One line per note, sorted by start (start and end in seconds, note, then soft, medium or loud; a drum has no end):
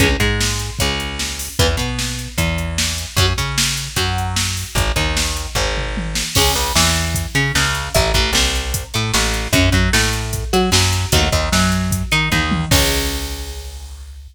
0.00 0.17 C#2 loud
0.00 0.08 E3 medium
0.00 0.08 G#3 medium
0.00 0.08 C#4 loud
0.00 kick loud
0.00 closed hi-hat medium
0.20 0.71 G#2 loud
0.20 0.71 G#3 medium
0.20 kick medium
0.20 closed hi-hat medium
0.40 snare loud
0.59 closed hi-hat medium
0.79 1.49 C#2 medium
0.79 1.47 C#3 medium
0.79 kick medium
0.79 closed hi-hat medium
1.00 closed hi-hat medium
1.19 snare medium
1.39 open hi-hat medium
1.59 1.76 E2 loud
1.59 1.67 E3 loud
1.59 1.67 B3 loud
1.59 kick loud
1.59 closed hi-hat medium
1.77 2.28 B2 medium
1.77 2.30 B3 medium
1.77 kick medium
1.77 closed hi-hat medium
1.99 snare medium
2.19 closed hi-hat medium
2.38 3.05 E2 medium
2.38 3.06 E3 medium
2.38 kick medium
2.38 closed hi-hat medium
2.58 closed hi-hat medium
2.78 snare loud
2.98 closed hi-hat medium
3.17 3.33 F#2 loud
3.17 3.26 F#3 medium
3.17 3.26 C#4 medium
3.17 kick loud
3.17 closed hi-hat medium
3.38 3.89 C#3 medium
3.38 3.88 C#4 medium
3.38 kick medium
3.38 closed hi-hat medium
3.58 snare loud
3.77 closed hi-hat medium
3.96 4.64 F#2 medium
3.96 4.65 F#3 medium
3.96 kick medium
3.96 closed hi-hat medium
4.18 closed hi-hat medium
4.36 snare loud
4.57 open hi-hat medium
4.75 4.92 G#1 loud
4.75 kick loud
4.75 closed hi-hat medium
4.96 5.47 D#2 medium
4.96 5.47 D#3 medium
4.96 kick medium
4.96 closed hi-hat medium
5.17 snare loud
5.37 closed hi-hat medium
5.55 6.23 G#1 loud
5.55 6.24 G#2 medium
5.55 kick medium
5.55 floor tom medium
5.77 mid tom medium
5.97 high tom medium
6.15 snare medium
6.35 6.54 C#2 loud
6.35 6.52 G#3 loud
6.35 6.52 C#4 loud
6.35 kick medium
6.35 crash loud
6.55 6.72 C#2 medium
6.55 6.73 C#3 medium
6.55 closed hi-hat medium
6.75 7.26 E2 loud
6.75 7.26 E3 medium
6.75 snare loud
6.95 closed hi-hat medium
7.15 kick medium
7.15 closed hi-hat loud
7.35 7.52 C#3 loud
7.35 7.52 C#4 loud
7.35 closed hi-hat medium
7.55 7.89 C#2 loud
7.55 7.89 C#3 medium
7.55 snare medium
7.75 closed hi-hat medium
7.94 8.12 A1 loud
7.94 8.11 A3 medium
7.94 8.11 E4 loud
7.94 kick loud
7.94 closed hi-hat loud
8.14 8.31 A1 medium
8.14 8.32 A2 medium
8.14 kick medium
8.14 closed hi-hat medium
8.33 8.83 C2 loud
8.33 8.85 C3 medium
8.33 snare loud
8.55 closed hi-hat medium
8.74 kick medium
8.74 closed hi-hat loud
8.94 9.12 A2 loud
8.94 9.11 A3 medium
8.94 closed hi-hat medium
9.14 9.48 A1 loud
9.14 9.48 A2 medium
9.14 snare loud
9.34 closed hi-hat medium
9.53 9.70 F#2 loud
9.53 9.70 C#4 loud
9.53 9.70 F#4 medium
9.53 kick loud
9.53 closed hi-hat loud
9.72 9.89 F#2 medium
9.72 9.91 F#3 medium
9.72 kick medium
9.72 closed hi-hat medium
9.93 10.45 A2 medium
9.93 10.44 A3 medium
9.93 snare loud
10.13 closed hi-hat medium
10.33 kick medium
10.33 closed hi-hat medium
10.53 10.70 F#3 loud
10.53 10.70 F#4 loud
10.53 closed hi-hat medium
10.72 11.06 F#2 loud
10.72 11.07 F#3 loud
10.72 snare loud
10.93 closed hi-hat medium
11.12 11.29 D#2 loud
11.12 11.28 A3 loud
11.12 11.28 D#4 medium
11.12 11.28 F#4 medium
11.12 kick loud
11.12 closed hi-hat loud
11.32 11.49 D#2 medium
11.32 11.49 D#3 medium
11.32 kick medium
11.32 closed hi-hat medium
11.52 12.03 F#2 loud
11.52 12.03 F#3 medium
11.52 snare medium
11.72 closed hi-hat medium
11.91 kick medium
11.91 closed hi-hat loud
12.12 12.29 D#3 loud
12.12 12.29 D#4 loud
12.12 closed hi-hat medium
12.32 12.65 D#2 loud
12.32 12.66 D#3 medium
12.32 kick medium
12.32 high tom medium
12.51 high tom loud
12.71 14.28 C#2 loud
12.71 14.28 G#3 medium
12.71 14.28 C#4 medium
12.71 kick loud
12.71 crash loud